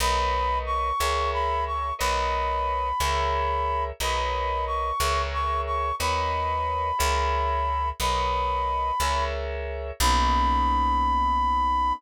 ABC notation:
X:1
M:6/8
L:1/8
Q:3/8=60
K:Bmix
V:1 name="Brass Section"
b2 c'2 b c' | b6 | b2 c'2 c' c' | b6 |
b4 z2 | b6 |]
V:2 name="Electric Piano 2"
[^ABcd]3 [GAce]3 | [^ABcd]3 [GAce]3 | [^ABcd]3 [GAce]3 | [^ABcd]3 [GAce]3 |
[^ABcd]3 [GAce]3 | [^A,B,CD]6 |]
V:3 name="Electric Bass (finger)" clef=bass
B,,,3 C,,3 | B,,,3 C,,3 | B,,,3 C,,3 | D,,3 C,,3 |
B,,,3 C,,3 | B,,,6 |]